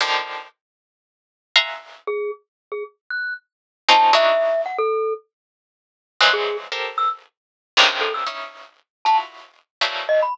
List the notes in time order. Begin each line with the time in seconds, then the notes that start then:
0.01 D3 D#3 F3
1.56 E5 F5 F#5 G#5 A#5 C6
2.07 G#4
2.72 G#4
3.10 F#6
3.88 C4 C#4 D#4 F4 A5
4.13 D4 D#4 E4 F#4 E5
4.66 F#5
4.78 A4
6.21 E3 F3 F#3 G#3 F#6
6.33 G#4
6.72 G4 A4 A#4 C5
6.98 E6
7.77 G#2 A#2 C3 C#3 D3 D#3
8.01 A4
8.14 E6
8.26 C#4 D#4 E4
9.05 E4 F4 F#4 A5
9.81 E3 F3 F#3 G3 A3 A#3
10.09 D#5
10.23 B5